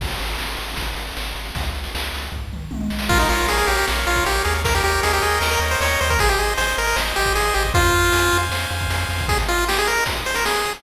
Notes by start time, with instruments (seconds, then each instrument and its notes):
0.00 synth bass 1 G#1, kick, crash
0.09 closed hi-hat
0.19 synth bass 1 G#1, closed hi-hat
0.29 closed hi-hat
0.38 synth bass 1 G#1, snare
0.48 closed hi-hat
0.57 synth bass 1 G#1, closed hi-hat
0.69 closed hi-hat
0.76 synth bass 1 G#1, kick, closed hi-hat
0.87 closed hi-hat
0.95 synth bass 1 G#1, closed hi-hat
1.07 closed hi-hat
1.17 synth bass 1 G#1, snare
1.26 closed hi-hat
1.35 synth bass 1 G#1, closed hi-hat
1.45 closed hi-hat
1.55 synth bass 1 C#2, kick, closed hi-hat
1.63 closed hi-hat
1.73 synth bass 1 C#2, closed hi-hat
1.84 closed hi-hat
1.95 synth bass 1 C#2, snare
2.04 closed hi-hat
2.13 synth bass 1 C#2, closed hi-hat
2.22 closed hi-hat
2.32 synth bass 1 C#2, kick, floor tom
2.50 synth bass 1 C#2, mid tom
2.71 synth bass 1 C2, high tom
2.80 high tom
2.90 synth bass 1 B1, snare
2.99 snare
3.09 synth bass 1 A#1, lead 1 (square) F4 A#4, kick, crash
3.19 lead 1 (square) D#4, closed hi-hat
3.29 synth bass 1 A#1, lead 1 (square) F4 C#5, closed hi-hat
3.40 closed hi-hat
3.47 synth bass 1 A#1, lead 1 (square) G#4 F5, closed hi-hat
3.57 lead 1 (square) G#4, closed hi-hat
3.67 synth bass 1 A#1, lead 1 (square) G4 C#5, closed hi-hat
3.77 lead 1 (square) G4, closed hi-hat
3.87 synth bass 1 A#1, lead 1 (square) A#4, snare
3.96 closed hi-hat
4.07 synth bass 1 A#1, lead 1 (square) F4 C#5, closed hi-hat
4.16 kick, closed hi-hat
4.25 synth bass 1 A#1, lead 1 (square) G4 F5, closed hi-hat
4.35 closed hi-hat
4.45 synth bass 1 D#2, lead 1 (square) G#4 C#5, closed hi-hat
4.54 closed hi-hat
4.64 lead 1 (square) A#4, kick, closed hi-hat
4.75 lead 1 (square) G4, closed hi-hat
4.83 synth bass 1 D#2, lead 1 (square) G4 C#5, closed hi-hat
4.94 closed hi-hat
5.03 synth bass 1 D#2, lead 1 (square) G#4 D#5, closed hi-hat
5.13 lead 1 (square) G4, closed hi-hat
5.22 synth bass 1 D#2, lead 1 (square) G#4 G5, closed hi-hat
5.31 closed hi-hat
5.41 synth bass 1 D#2, lead 1 (square) A#4 D#5, snare
5.51 lead 1 (square) A#4, closed hi-hat
5.59 synth bass 1 D#2, lead 1 (square) C#5, closed hi-hat
5.71 lead 1 (square) C5, closed hi-hat
5.80 synth bass 1 D#2, lead 1 (square) A#4 C#5, closed hi-hat
5.90 closed hi-hat
6.00 synth bass 1 D#2, lead 1 (square) C5 C#5, closed hi-hat
6.10 lead 1 (square) A#4, kick, closed hi-hat
6.19 synth bass 1 G#1, lead 1 (square) G#4 C5, kick, closed hi-hat
6.28 lead 1 (square) G4, closed hi-hat
6.38 synth bass 1 G#1, lead 1 (square) G#4 D#5, closed hi-hat
6.48 closed hi-hat
6.57 synth bass 1 G#1, lead 1 (square) C5 G#5, closed hi-hat
6.67 lead 1 (square) C5, closed hi-hat
6.77 synth bass 1 G#1, lead 1 (square) A#4 D#5, closed hi-hat
6.86 lead 1 (square) A#4, closed hi-hat
6.96 synth bass 1 G#1, lead 1 (square) C5, snare
7.06 closed hi-hat
7.16 synth bass 1 G#1, lead 1 (square) G4 D#5, closed hi-hat
7.26 kick, closed hi-hat
7.35 synth bass 1 G#1, lead 1 (square) G#4 G#5, closed hi-hat
7.45 closed hi-hat
7.54 synth bass 1 G#1, lead 1 (square) G4 D#5, closed hi-hat
7.65 kick, closed hi-hat
7.74 synth bass 1 F2, lead 1 (square) F4 C5, kick, closed hi-hat
7.85 closed hi-hat
7.94 synth bass 1 F2, lead 1 (square) F5, closed hi-hat
8.03 closed hi-hat
8.12 synth bass 1 F2, lead 1 (square) G#5, closed hi-hat
8.22 closed hi-hat
8.31 synth bass 1 F2, lead 1 (square) F5, closed hi-hat
8.43 closed hi-hat
8.50 synth bass 1 F2, lead 1 (square) C5, snare
8.61 closed hi-hat
8.70 synth bass 1 F2, lead 1 (square) F5, closed hi-hat
8.80 kick, closed hi-hat
8.89 synth bass 1 F2, lead 1 (square) G#5, closed hi-hat
9.00 closed hi-hat
9.09 synth bass 1 F2, lead 1 (square) F5, closed hi-hat
9.18 kick, open hi-hat
9.28 lead 1 (square) G#4, kick, closed hi-hat
9.38 lead 1 (square) C5, closed hi-hat
9.48 lead 1 (square) F4 D#5, closed hi-hat
9.58 lead 1 (square) C6, closed hi-hat
9.67 lead 1 (square) G4 D#6, snare
9.76 lead 1 (square) G#4, closed hi-hat
9.86 lead 1 (square) A#4 C5, closed hi-hat
9.96 lead 1 (square) D#5, closed hi-hat
10.06 lead 1 (square) C6, kick, closed hi-hat
10.17 lead 1 (square) D#6, closed hi-hat
10.25 lead 1 (square) G#4 C5, closed hi-hat
10.34 lead 1 (square) A#4 C5, closed hi-hat
10.44 lead 1 (square) G#4 D#5, snare
10.55 lead 1 (square) C6, closed hi-hat
10.65 lead 1 (square) D#6, closed hi-hat
10.74 lead 1 (square) G#4, open hi-hat